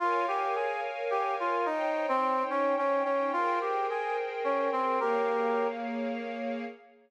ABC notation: X:1
M:3/4
L:1/16
Q:1/4=108
K:Bbdor
V:1 name="Brass Section"
F2 G2 A2 z2 G2 F2 | E3 C3 D2 D2 D2 | F2 G2 A2 z2 D2 C2 | [GB]6 z6 |]
V:2 name="String Ensemble 1"
[Bdfa]12 | [Ecdg]12 | [ABcg]12 | [B,Adf]12 |]